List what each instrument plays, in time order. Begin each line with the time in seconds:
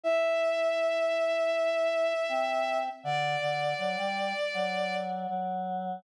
0.04 choir aahs E4, violin E5
2.29 choir aahs C4
3.04 choir aahs D3, violin D5
3.41 choir aahs D3
3.78 choir aahs F#3
3.97 choir aahs G3
4.54 choir aahs F#3
5.29 choir aahs F#3